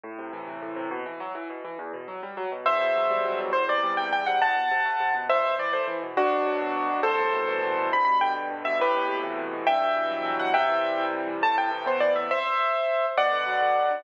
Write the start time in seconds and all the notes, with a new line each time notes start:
0.04 A2
0.18 C3
0.33 E3
0.47 C3
0.62 A2
0.76 C3
0.91 B2
1.06 E3
1.20 F#3
1.35 E3
1.50 B2
1.64 E3
1.79 E2
1.93 B2
2.08 F#3
2.23 G3
2.37 F#3
2.52 B2
2.66 E2 C5 E5
2.81 B2
2.95 F#3
3.10 G3
3.25 F#3
3.39 B2
3.53 E2 C5
3.68 C3 D5
3.83 G3
3.97 C3 G5
4.13 E2 G5
4.26 C3 F#5
4.42 E2 F#5 A5
4.56 B2
4.71 C3
4.85 A3
5.00 C3
5.14 B2
5.29 C2 C5 E5
5.44 B2
5.59 E3 D5
5.73 A3 C5
5.87 E3
6.02 B2
6.17 D2 D4 F#4
6.31 B2
6.46 F#3
6.61 B2
6.75 D2
6.90 B2
7.03 C2 A4 C5
7.19 A2
7.33 B2
7.48 E3
7.63 B2
7.77 A2
7.92 G2 B5
8.05 B2 B5
8.21 D3 G5
8.36 B2
8.50 G2
8.65 B2 E5
8.79 A2 G4 B4
8.94 B2
9.09 C3
9.23 E3
9.38 C3
9.52 B2
9.67 G2 E5 G5
9.82 B2
9.96 E3
10.11 F#3
10.25 E3
10.39 B2 F#5
10.54 C3 E5 G5
10.69 E3
10.84 G3
10.98 E3
11.13 C3
11.27 E3
11.42 A2 A5
11.57 C3 G5
11.71 E3
11.86 B3 C5
12.00 E3 D5
12.15 C3 E5
12.31 C5 E5
13.17 B2 D5 F#5
13.32 D3
13.47 F#3
13.61 D3
13.76 B2
13.90 D3